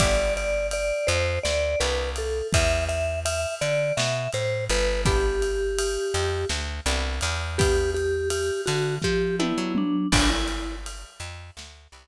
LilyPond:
<<
  \new Staff \with { instrumentName = "Vibraphone" } { \time 7/8 \key g \major \tempo 4 = 83 d''8 d''8 d''8 c''8 d''8 b'8 a'8 | e''8 e''8 e''8 d''8 e''8 c''8 b'8 | g'2 r4. | g'8 g'8 g'8 fis'8 g'8 e'8 d'8 |
d'16 e'8. r2 r8 | }
  \new Staff \with { instrumentName = "Acoustic Guitar (steel)" } { \time 7/8 \key g \major <b d' e' g'>2~ <b d' e' g'>8 <b d' e' g'>4 | r2. r8 | <b d' e' g'>2~ <b d' e' g'>8 <b d' e' g'>4 | <b d' e' g'>2~ <b d' e' g'>8 <b d' e' g'>4 |
<b' d'' e'' g''>2~ <b' d'' e'' g''>8 <b' d'' e'' g''>4 | }
  \new Staff \with { instrumentName = "Electric Bass (finger)" } { \clef bass \time 7/8 \key g \major g,,4. f,8 d,8 c,4 | e,4. d8 b,8 a,8 g,,8~ | g,,4. f,8 d,8 c,8 e,8~ | e,4. d8 f8. fis8. |
g,,4. f,8 d,8 c,4 | }
  \new DrumStaff \with { instrumentName = "Drums" } \drummode { \time 7/8 <bd cymr>8 cymr8 cymr8 cymr8 sn8 cymr8 cymr8 | <bd cymr>8 cymr8 cymr8 cymr8 sn8 cymr8 cymr8 | <bd cymr>8 cymr8 cymr8 cymr8 sn8 cymr8 cymr8 | <bd cymr>8 cymr8 cymr8 cymr8 <bd sn>8 tommh8 toml8 |
<cymc bd>8 cymr8 cymr8 cymr8 sn8 cymr4 | }
>>